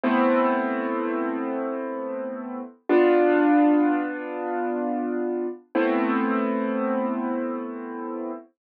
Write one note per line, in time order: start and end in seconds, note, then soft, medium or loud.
0.04 2.61 A3 loud
0.04 2.61 B3 medium
0.04 2.61 C4 loud
0.04 2.61 E4 loud
2.89 5.47 B3 loud
2.89 5.47 D4 loud
2.89 5.47 F4 loud
5.75 8.32 A3 medium
5.75 8.32 B3 medium
5.75 8.32 C4 loud
5.75 8.32 E4 loud